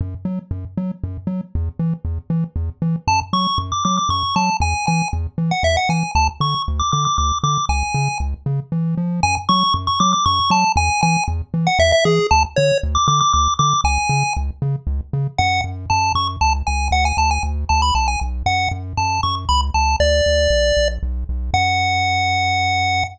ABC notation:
X:1
M:3/4
L:1/16
Q:1/4=117
K:F#m
V:1 name="Lead 1 (square)"
z12 | z12 | a z c'2 z d' d' d' c'2 a2 | g2 g2 z3 f e f g2 |
a z c'2 z d' d' d' d'2 d'2 | g4 z8 | g z c'2 z c' d' d' c'2 a2 | g2 g2 z3 f e e G2 |
a z c2 z d' d' d' d'2 d'2 | g4 z8 | f2 z2 a2 c' z a z g2 | f g a g z2 a b a g z2 |
f2 z2 a2 c' z b z a2 | d8 z4 | f12 |]
V:2 name="Synth Bass 1" clef=bass
F,,2 F,2 F,,2 F,2 F,,2 F,2 | E,,2 E,2 E,,2 E,2 E,,2 E,2 | F,,2 F,2 F,,2 F,2 F,,2 F,2 | E,,2 E,2 E,,2 E,2 E,,2 E,2 |
D,,2 D,2 D,,2 D,2 D,,2 D,2 | C,,2 C,2 C,,2 C,2 E,2 ^E,2 | F,,2 F,2 F,,2 F,2 F,,2 F,2 | E,,2 E,2 E,,2 E,2 E,,2 E,2 |
D,,2 D,2 D,,2 D,2 D,,2 D,2 | C,,2 C,2 C,,2 C,2 C,,2 C,2 | F,,2 F,,2 F,,2 F,,2 C,,2 C,,2 | D,,2 D,,2 D,,2 D,,2 B,,,2 B,,,2 |
F,,2 F,,2 F,,2 F,,2 C,,2 C,,2 | D,,2 D,,2 ^A,,,2 A,,,2 B,,,2 B,,,2 | F,,12 |]